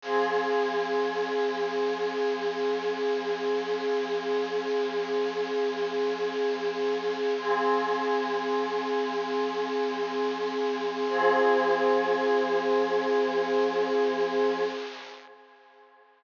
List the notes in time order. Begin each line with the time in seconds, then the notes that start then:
0.02 F3 C4 G#4
7.38 F3 C4 G#4
11.08 F3 C4 G#4